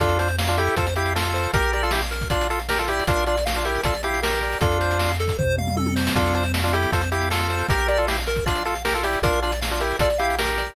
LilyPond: <<
  \new Staff \with { instrumentName = "Lead 1 (square)" } { \time 4/4 \key f \major \tempo 4 = 156 <d' f'>8 <d' f'>16 r8 <d' f'>16 <e' g'>8 <f' a'>16 r16 <e' g'>8 <f' a'>4 | <g' bes'>8 <g' bes'>16 <f' a'>16 <e' g'>16 r8. <d' f'>8 <f' a'>16 r16 <g' bes'>16 <f' a'>16 <e' g'>8 | <d' f'>8 <d' f'>16 r8 <d' f'>16 <e' g'>8 <f' a'>16 r16 <e' g'>8 <g' bes'>4 | <d' f'>4. r2 r8 |
<d' f'>8 <d' f'>16 r8 <d' f'>16 <e' g'>8 <f' a'>16 r16 <e' g'>8 <f' a'>4 | <g' bes'>8 <g' bes'>16 <f' a'>16 <e' g'>16 r8. <d' f'>8 <f' a'>16 r16 <g' bes'>16 <f' a'>16 <e' g'>8 | <d' f'>8 <d' f'>16 r8 <d' f'>16 <e' g'>8 <f' a'>16 r16 <e' g'>8 <g' bes'>4 | }
  \new Staff \with { instrumentName = "Lead 1 (square)" } { \time 4/4 \key f \major a'8 c''8 f''8 a'8 c''8 f''8 a'8 c''8 | bes'8 d''8 f''8 bes'8 d''8 f''8 bes'8 d''8 | bes'8 d''8 f''8 bes'8 d''8 f''8 bes'8 d''8 | a'8 c''8 f''8 a'8 c''8 f''8 a'8 c''8 |
a'8 c''8 f''8 a'8 c''8 f''8 a'8 c''8 | bes'8 d''8 f''8 bes'8 d''8 f''8 bes'8 d''8 | bes'8 d''8 f''8 bes'8 d''8 f''8 bes'8 d''8 | }
  \new Staff \with { instrumentName = "Synth Bass 1" } { \clef bass \time 4/4 \key f \major f,2 f,2 | bes,,2 bes,,2 | bes,,2 bes,,2 | f,2 f,2 |
f,2 f,2 | bes,,2 bes,,2 | bes,,2 bes,,2 | }
  \new DrumStaff \with { instrumentName = "Drums" } \drummode { \time 4/4 <hh bd>16 hh16 hh16 hh16 sn16 hh16 hh16 hh16 <hh bd>16 hh16 hh16 hh16 sn16 hh16 hh16 hh16 | <hh bd>16 hh16 hh16 hh16 sn16 hh16 hh16 <hh bd>16 <hh bd>16 hh16 hh16 hh16 sn16 hh16 hh16 hh16 | <hh bd>16 hh16 hh16 hh16 sn16 hh16 hh16 hh16 <hh bd>16 hh16 hh16 hh16 sn16 hh16 hh16 hh16 | <hh bd>16 hh16 hh16 hh16 sn16 hh16 hh16 <hh bd>16 <bd tomfh>8 toml16 toml16 tommh16 tommh16 sn16 sn16 |
<hh bd>16 hh16 hh16 hh16 sn16 hh16 hh16 hh16 <hh bd>16 hh16 hh16 hh16 sn16 hh16 hh16 hh16 | <hh bd>16 hh16 hh16 hh16 sn16 hh16 hh16 <hh bd>16 <hh bd>16 hh16 hh16 hh16 sn16 hh16 hh16 hh16 | <hh bd>16 hh16 hh16 hh16 sn16 hh16 hh16 hh16 <hh bd>16 hh16 hh16 hh16 sn16 hh16 hh16 hh16 | }
>>